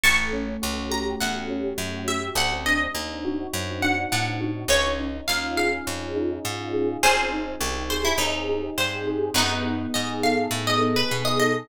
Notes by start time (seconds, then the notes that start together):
0.04 A1 A3 A5 C#6
0.33 C#4
0.62 C#2 F#4
0.91 G4 A#5
1.20 E2 A3 F#5
1.49 C#4
1.78 F#2 F#4
2.08 G4 E5
2.35 D2 C4 F#5
2.66 D4 D#5
2.95 D#2 D#4
3.25 F#4
3.53 F#2 C4
3.82 D4 F#5
4.12 A2 D#4 F#5
4.41 F#4
4.68 C#2 C#4 C#5
4.99 D#4
5.28 D#2 F4 F5
5.57 G#4 F5
5.87 F2 C#4
6.16 D#4
6.45 G#2 F4
6.74 G#4
7.03 G#1 C4 G#4 C5
7.32 D#4
7.61 C2 G4
7.90 G#4 C5
8.05 E4
8.18 D#2 C4 D#4
8.49 D#4
8.78 G2 G4 C5
9.07 G#4
9.34 F#2 B3 D#4
9.65 D#4
9.94 G#2 G#4 D#5
10.23 A4 F5
10.51 A2 B3
10.67 D#5
10.82 D#4
10.96 B4
11.11 B2 G#4
11.25 D#5
11.40 A4 D#5